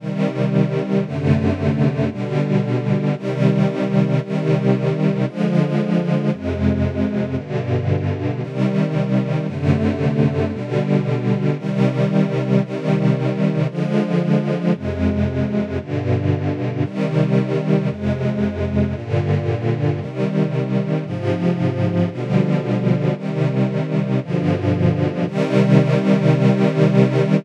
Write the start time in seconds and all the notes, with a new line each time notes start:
0.00 C3 D#3 G3
1.05 F#2 C3 D3 A3
2.11 B2 D3 G3
3.16 C3 D#3 G3
4.21 C3 D#3 G3
5.26 D3 F3 G#3
6.32 F2 C3 G#3
7.37 G2 B2 D3
8.42 C3 D#3 G3
9.47 F#2 C3 D3 A3
10.53 B2 D3 G3
11.58 C3 D#3 G3
12.63 C3 D#3 G3
13.69 D3 F3 G#3
14.74 F2 C3 G#3
15.79 G2 B2 D3
16.84 C3 D#3 G3
17.89 F2 C3 G#3
18.95 G2 A#2 D3
20.00 C3 D#3 G3
21.05 G#2 C3 F3
22.11 B2 D3 F3 G3
23.16 C3 D#3 G3
24.21 G2 B2 D3 F3
25.26 C3 D#3 G3